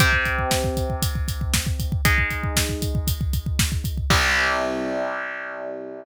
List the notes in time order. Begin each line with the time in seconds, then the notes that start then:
0.00 C3 C4 G4, kick, closed hi-hat
0.13 kick
0.25 kick, closed hi-hat
0.39 kick
0.51 kick, snare
0.64 kick
0.77 kick, closed hi-hat
0.90 kick
1.02 kick, closed hi-hat
1.15 kick
1.28 kick, closed hi-hat
1.41 kick
1.54 kick, snare
1.67 kick
1.80 kick, closed hi-hat
1.92 kick
2.05 G#3 D#4 G#4, kick, closed hi-hat
2.18 kick
2.31 kick, closed hi-hat
2.43 kick
2.56 kick, snare
2.69 kick
2.82 kick, closed hi-hat
2.95 kick
3.07 kick, closed hi-hat
3.21 kick
3.33 kick, closed hi-hat
3.46 kick
3.59 kick, snare
3.72 kick
3.84 kick, closed hi-hat
3.98 kick
4.10 C2 C3 G3, kick, crash